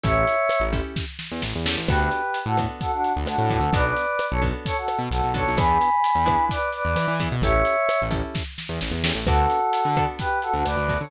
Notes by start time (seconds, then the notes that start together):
0.03 A1 C#4 E4 G4 A4 C#5 E5, kick, closed hi-hat
0.27 closed hi-hat
0.49 cross-stick, closed hi-hat
0.60 A1
0.73 C#4 E4 G4 A4, kick, closed hi-hat
0.96 kick, snare
1.19 snare
1.31 E2
1.42 A1, snare
1.55 E2
1.66 C#4 E4 G4 A4, snare
1.77 A1
1.88 D2 B3 D4 F#4 G4 A4 B4, kick, cross-stick, closed hi-hat
2.00 G4 B4
2.11 closed hi-hat
2.34 closed hi-hat
2.46 A2 F#4 A4
2.57 B3 D4 F#4 A4, kick, cross-stick, closed hi-hat
2.81 F#4 A4, kick, closed hi-hat
2.92 D4 F#4
3.04 closed hi-hat
3.16 D2
3.26 D2 D4 F#4, cross-stick, closed hi-hat
3.38 A2
3.50 B3 D4 F#4 A4, kick, closed hi-hat
3.60 D2
3.72 B1 B3 D4 F#4 A4 B4 D5, kick, closed hi-hat
3.85 B4 D5
3.96 closed hi-hat
4.19 cross-stick, closed hi-hat
4.31 B1 A4 C#5
4.42 B3 D4 F#4 A4, kick, closed hi-hat
4.66 A4 C#5, kick, closed hi-hat
4.77 F#4 A4
4.88 cross-stick, closed hi-hat
4.98 B2
5.11 B1 F#4 A4, closed hi-hat
5.24 B1
5.34 B3 D4 F#4 A4 C#5, kick, closed hi-hat
5.47 B1
5.57 E2 B3 D4 E4 G#4 G#5 B5, kick, cross-stick, closed hi-hat
5.81 closed hi-hat
6.04 closed hi-hat
6.15 E2
6.26 B3 D4 E4 G#4, kick, cross-stick, closed hi-hat
6.49 B4 D5, kick, closed hi-hat
6.72 B4 D5, closed hi-hat
6.85 E2
6.96 E3, cross-stick, closed hi-hat
7.08 E3
7.20 B3 D4 E4 G#4, kick, closed hi-hat
7.32 B2
7.42 A1 C#4 E4 G4 A4 C#5 E5, kick, closed hi-hat
7.65 closed hi-hat
7.89 cross-stick, closed hi-hat
8.02 A1
8.11 C#4 E4 G4 A4, kick, closed hi-hat
8.35 kick, snare
8.58 snare
8.69 E2
8.81 A1, snare
8.91 E2
9.04 C#4 E4 G4 A4, snare
9.15 A1
9.26 D2 B3 D4 F#4 A4, kick, cross-stick, closed hi-hat
9.50 closed hi-hat
9.73 closed hi-hat
9.85 D3
9.97 B3 D4 F#4 A4, kick, cross-stick, closed hi-hat
10.19 G4 B4, kick, closed hi-hat
10.42 F#4 A4, closed hi-hat
10.53 D2 D4 F#4
10.65 D2 B4 D5, cross-stick, closed hi-hat
10.76 D2
10.89 B3 D4 F#4 A4, kick, closed hi-hat
11.00 D3 A4 C#5